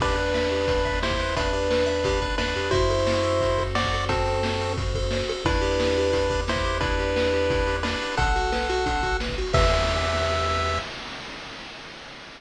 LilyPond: <<
  \new Staff \with { instrumentName = "Lead 1 (square)" } { \time 4/4 \key e \minor \tempo 4 = 176 <d' b'>2. <e' c''>4 | <d' b'>2. <d' b'>4 | <e' c''>2. <fis' d''>4 | <c' a'>2 r2 |
<d' b'>2. <e' c''>4 | <d' b'>2. <d' b'>4 | <a' fis''>2. r4 | e''1 | }
  \new Staff \with { instrumentName = "Lead 1 (square)" } { \time 4/4 \key e \minor g'8 b'8 e''8 g'8 b'8 e''8 g'8 b'8 | e''8 g'8 b'8 e''8 g'8 b'8 e''8 g'8 | fis'8 a'8 c''8 a'8 fis'8 a'8 c''8 a'8 | fis'8 a'8 c''8 a'8 fis'8 a'8 c''8 a'8 |
e'8 g'8 b'8 g'8 e'8 g'8 b'8 g'8 | e'8 g'8 b'8 g'8 e'8 g'8 b'8 g'8 | d'8 fis'8 b'8 fis'8 d'8 fis'8 b'8 fis'8 | <g' b' e''>1 | }
  \new Staff \with { instrumentName = "Synth Bass 1" } { \clef bass \time 4/4 \key e \minor e,1~ | e,2. e,8 f,8 | fis,1~ | fis,1 |
e,1~ | e,1 | b,,1 | e,1 | }
  \new DrumStaff \with { instrumentName = "Drums" } \drummode { \time 4/4 <cymc bd>16 hh8 hh16 sn16 hh16 hh16 hh16 <hh bd>16 hh16 <hh bd>16 hh16 sn16 <hh bd>16 hh16 hh16 | <hh bd>16 hh8 hh16 sn16 hh16 hh16 hh16 <hh bd>16 hh16 <hh bd>16 hh16 sn16 hh16 hh16 hh16 | <hh bd>16 hh16 hh16 hh16 sn16 hh16 hh16 hh16 <hh bd>16 hh16 <hh bd>16 hh16 sn16 <hh bd>16 hh16 hh16 | <hh bd>16 hh16 hh16 hh16 sn16 hh16 hh16 hh16 <hh bd>16 hh16 <hh bd>16 hh16 sn16 hh16 hh16 hh16 |
<hh bd>16 hh16 hh16 hh16 sn16 hh16 hh16 hh16 <hh bd>16 hh16 <hh bd>16 hh16 sn16 <hh bd>16 hh16 hh16 | <hh bd>16 hh16 hh16 hh16 sn16 hh16 hh16 hh16 <hh bd>16 hh16 hh16 hh16 sn16 hh16 hh16 hh16 | <hh bd>16 hh16 hh16 hh16 sn16 hh16 hh16 hh16 <hh bd>16 hh16 <hh bd>16 hh16 sn16 <hh bd>16 hh16 hho16 | <cymc bd>4 r4 r4 r4 | }
>>